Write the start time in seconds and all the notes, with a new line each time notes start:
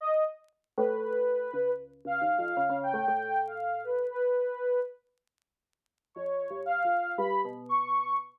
0.01 D#5
0.77 A2 B4
1.01 B4
1.53 C#2
2.05 C#2 F5
2.21 D#2
2.38 F2
2.57 C#3
2.69 C#3
2.83 G5
2.93 A2
3.08 A2
3.47 F5
3.84 B4
4.11 B4
6.15 F2 C#5
6.50 G2
6.66 F5
6.85 F2
7.18 G2 B5
7.45 B2
7.69 C#6